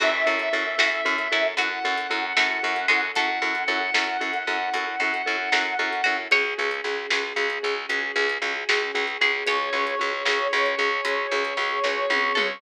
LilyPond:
<<
  \new Staff \with { instrumentName = "Brass Section" } { \time 12/8 \key fis \minor \tempo 4. = 76 e''2. fis''2. | fis''1. | r1. | cis''1. | }
  \new Staff \with { instrumentName = "Pizzicato Strings" } { \time 12/8 \key fis \minor fis'4. fis'8 r8 e'8 fis'4. a4 gis8 | a'2. r2 r8 fis'8 | cis''2. r2 r8 gis'8 | cis''2. r2 r8 a'8 | }
  \new Staff \with { instrumentName = "Vibraphone" } { \time 12/8 \key fis \minor <cis' e' fis' a'>8 <cis' e' fis' a'>8 <cis' e' fis' a'>8 <cis' e' fis' a'>8 <cis' e' fis' a'>8 <cis' e' fis' a'>8 <cis' e' fis' a'>8 <cis' e' fis' a'>8 <cis' e' fis' a'>8 <cis' e' fis' a'>8 <cis' e' fis' a'>8 <cis' e' fis' a'>8 | <cis' e' fis' a'>8 <cis' e' fis' a'>8 <cis' e' fis' a'>8 <cis' e' fis' a'>8 <cis' e' fis' a'>8 <cis' e' fis' a'>8 <cis' e' fis' a'>8 <cis' e' fis' a'>8 <cis' e' fis' a'>8 <cis' e' fis' a'>8 <cis' e' fis' a'>8 <cis' e' fis' a'>8 | <cis' fis' gis'>8 <cis' fis' gis'>8 <cis' fis' gis'>8 <cis' fis' gis'>8 <cis' fis' gis'>8 <cis' fis' gis'>8 <cis' fis' gis'>8 <cis' fis' gis'>8 <cis' fis' gis'>8 <cis' fis' gis'>8 <cis' fis' gis'>8 <cis' fis' gis'>8 | <cis' fis' gis'>8 <cis' fis' gis'>8 <cis' fis' gis'>8 <cis' fis' gis'>8 <cis' fis' gis'>8 <cis' fis' gis'>8 <cis' fis' gis'>8 <cis' fis' gis'>8 <cis' fis' gis'>8 <cis' fis' gis'>8 <cis' fis' gis'>8 <cis' fis' gis'>8 | }
  \new Staff \with { instrumentName = "Electric Bass (finger)" } { \clef bass \time 12/8 \key fis \minor fis,8 fis,8 fis,8 fis,8 fis,8 fis,8 fis,8 fis,8 fis,8 fis,8 fis,8 fis,8 | fis,8 fis,8 fis,8 fis,8 fis,8 fis,8 fis,8 fis,8 fis,8 fis,8 fis,8 fis,8 | cis,8 cis,8 cis,8 cis,8 cis,8 cis,8 cis,8 cis,8 cis,8 cis,8 cis,8 cis,8 | cis,8 cis,8 cis,8 cis,8 cis,8 cis,8 cis,8 cis,8 cis,8 cis,8 cis,8 cis,8 | }
  \new Staff \with { instrumentName = "String Ensemble 1" } { \time 12/8 \key fis \minor <cis' e' fis' a'>1.~ | <cis' e' fis' a'>1. | <cis' fis' gis'>1.~ | <cis' fis' gis'>1. | }
  \new DrumStaff \with { instrumentName = "Drums" } \drummode { \time 12/8 <cymc bd>8. hh8. sn8. hh8. hh8. hh8. sn8. hh8. | <hh bd>8. hh8. sn8. hh8. hh8. hh8. sn8. hh8. | <hh bd>8. hh8. sn8. hh8. hh8. hh8. sn8. hh8. | <hh bd>8. hh8. sn8. hh8. hh8. hh8. <bd sn>8 tommh8 toml8 | }
>>